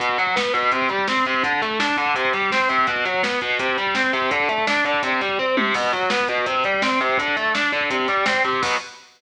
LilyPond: <<
  \new Staff \with { instrumentName = "Overdriven Guitar" } { \time 4/4 \key b \phrygian \tempo 4 = 167 b,8 fis8 b8 b,8 c8 g8 c'8 c8 | d8 a8 d'8 d8 c8 g8 c'8 c8 | b,8 fis8 b8 b,8 c8 g8 c'8 c8 | d8 a8 d'8 d8 c8 g8 c'8 c8 |
b,8 fis8 b8 b,8 c8 g8 c'8 c8 | d8 a8 d'8 d8 c8 g8 c'8 c8 | <b, fis b>4 r2. | }
  \new DrumStaff \with { instrumentName = "Drums" } \drummode { \time 4/4 <hh bd>16 bd16 <hh bd>16 bd16 <bd sn>16 bd16 <hh bd>16 bd16 <hh bd>16 bd16 <hh bd>16 bd16 <bd sn>16 bd16 <hh bd>16 bd16 | <hh bd>16 bd16 <hh bd>16 bd16 <bd sn>16 bd16 <hh bd>16 bd16 <hh bd>16 bd16 <hh bd>16 bd16 <bd sn>16 bd16 <hh bd>16 bd16 | <hh bd>16 bd16 <hh bd>16 bd16 <bd sn>16 bd16 <hh bd>16 bd16 <hh bd>16 bd16 <hh bd>16 bd16 <bd sn>16 bd16 <hh bd>16 bd16 | <hh bd>16 bd16 <hh bd>16 bd16 <bd sn>16 bd16 <hh bd>16 bd16 <hh bd>16 bd16 <hh bd>16 bd16 <bd tomfh>8 tommh8 |
<cymc bd>16 bd16 <hh bd>16 bd16 <bd sn>16 bd16 <hh bd>16 bd16 <hh bd>16 bd16 <hh bd>16 bd16 <bd sn>16 bd16 <hh bd>16 bd16 | <hh bd>16 bd16 <hh bd>16 bd16 <bd sn>16 bd16 <hh bd>16 bd16 <hh bd>16 bd16 <hh bd>16 bd16 <bd sn>16 bd16 <hh bd>16 bd16 | <cymc bd>4 r4 r4 r4 | }
>>